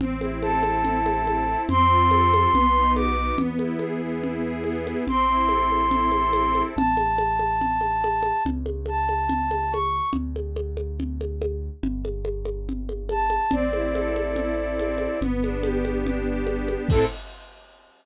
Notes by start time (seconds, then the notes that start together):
0.00 A1 C4, low conga
0.20 E4, high conga
0.42 A4 A5, high conga
0.63 C4, high conga
0.85 E4, low conga
1.05 A4, high conga
1.26 C4, high conga
1.48 E4
1.69 F2 C4 C6, low conga
1.89 F4
2.11 A4, high conga
2.33 C4, high conga
2.52 B1 B3, low conga
2.76 D#4
2.95 F#4 D6, high conga
3.17 B3
3.38 E2 B3, low conga
3.59 E4, high conga
3.79 G#4, high conga
4.01 B3
4.23 E4, low conga
4.44 G#4
4.64 B3, high conga
4.87 E4, high conga
5.07 A1 C4 C6, low conga
5.29 E4
5.49 A4, high conga
5.70 C4, high conga
5.91 E4, low conga
6.12 A4, high conga
6.33 C4, high conga
6.54 E4, high conga
6.76 A1 A5, low conga
6.97 high conga
7.18 high conga
7.39 high conga
7.61 low conga
7.81 high conga
8.04 high conga
8.23 high conga
8.45 C#2, low conga
8.66 high conga
8.86 A5, high conga
9.09 high conga
9.29 low conga
9.51 high conga
9.72 C#6, high conga
10.13 D2, low conga
10.36 high conga
10.56 high conga
10.77 high conga
11.00 low conga
11.21 high conga
11.42 high conga
11.83 G1, low conga
12.05 high conga
12.25 high conga
12.45 high conga
12.69 low conga
12.89 high conga
13.09 A5, high conga
13.30 high conga
13.51 A1 C4 D5, low conga
13.73 E4, high conga
13.95 A4, high conga
14.16 C4, high conga
14.36 E4, low conga
14.56 A4
14.79 C4, high conga
14.98 E4, high conga
15.21 G1 B3, low conga
15.42 D4, high conga
15.62 G4, high conga
15.84 B3, high conga
16.06 D4, low conga
16.29 G4
16.47 B3, high conga
16.68 D4, high conga
16.89 A2 C4 E4 A4, kick, crash